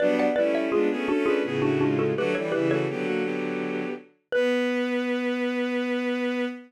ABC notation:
X:1
M:3/4
L:1/16
Q:1/4=83
K:Bm
V:1 name="Xylophone"
[Bd] [df] [Bd] [ce] [^E^G]2 [DF] [EG]2 [DF] [DF] [FA] | [GB] [Ac] [GB] [Ac]7 z2 | B12 |]
V:2 name="Violin"
[F,D]2 [G,E]2 [^G,^E] [B,^G] [CA] [DB] [B,G] [A,F] [G,E]2 | [A,F] [G,E] [G,E] [A,F] [B,G] [^A,F] [B,G]4 z2 | B12 |]
V:3 name="Violin"
[G,B,]2 [A,C]2 [B,D] [A,C] [A,C]2 [A,,C,]4 | [D,F,] [E,G,] [C,E,]2 [D,F,]6 z2 | B,12 |]